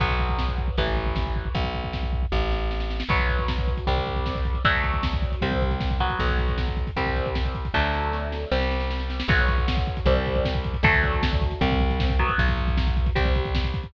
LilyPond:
<<
  \new Staff \with { instrumentName = "Overdriven Guitar" } { \time 4/4 \key b \phrygian \tempo 4 = 155 <fis b>2 <e a>2 | r1 | <fis b>2 <g c'>2 | <fis a d'>2 <g c'>4. <fis b>8~ |
<fis b>2 <g c'>2 | <fis a d'>2 <g c'>2 | <fis b>2 <g c'>2 | <fis a d'>2 <g c'>4. <fis b>8~ |
<fis b>2 <g c'>2 | }
  \new Staff \with { instrumentName = "Electric Bass (finger)" } { \clef bass \time 4/4 \key b \phrygian b,,2 a,,2 | b,,2 a,,2 | b,,2 c,2 | d,2 c,2 |
b,,2 c,2 | d,2 c,2 | b,,2 c,2 | d,2 c,2 |
b,,2 c,2 | }
  \new DrumStaff \with { instrumentName = "Drums" } \drummode { \time 4/4 <cymc bd>16 bd16 bd16 bd16 <bd sn>16 bd16 bd16 bd16 <hh bd>16 bd16 bd16 bd16 <bd sn>16 bd16 bd16 bd16 | <hh bd>16 bd16 bd16 bd16 <bd sn>16 bd16 bd16 bd16 <bd sn>8 sn8 sn16 sn16 sn16 sn16 | <cymc bd>16 <hh bd>16 <hh bd>16 <hh bd>16 <bd sn>16 <hh bd>16 <hh bd>16 <hh bd>16 <hh bd>16 <hh bd>16 <hh bd>16 <hh bd>16 <bd sn>16 <hh bd>16 <hh bd>16 <hh bd>16 | <hh bd>16 <hh bd>16 <hh bd>16 <hh bd>16 <bd sn>16 <hh bd>16 <hh bd>16 <hh bd>16 <hh bd>16 <hh bd>16 <hh bd>16 <hh bd>16 <bd sn>16 <hh bd>16 <hh bd>16 <hh bd>16 |
<hh bd>16 <hh bd>16 <hh bd>16 <hh bd>16 <bd sn>16 <hh bd>16 <hh bd>16 <hh bd>16 <hh bd>16 <hh bd>16 <hh bd>16 <hh bd>16 <bd sn>16 <hh bd>16 <hh bd>16 <hh bd>16 | <bd sn>8 sn8 sn8 sn8 sn16 sn16 sn16 sn16 sn16 sn16 sn16 sn16 | <cymc bd>16 <hh bd>16 <hh bd>16 <hh bd>16 <bd sn>16 <hh bd>16 <hh bd>16 <hh bd>16 <hh bd>16 <hh bd>16 <hh bd>16 <hh bd>16 <bd sn>16 <hh bd>16 <hh bd>16 <hh bd>16 | <hh bd>16 <hh bd>16 <hh bd>16 <hh bd>16 <bd sn>16 <hh bd>16 <hh bd>16 <hh bd>16 <hh bd>16 <hh bd>16 <hh bd>16 <hh bd>16 <bd sn>16 <hh bd>16 <hh bd>16 <hh bd>16 |
<hh bd>16 <hh bd>16 <hh bd>16 <hh bd>16 <bd sn>16 <hh bd>16 <hh bd>16 <hh bd>16 <hh bd>16 <hh bd>16 <hh bd>16 <hh bd>16 <bd sn>16 <hh bd>16 <hh bd>16 <hh bd>16 | }
>>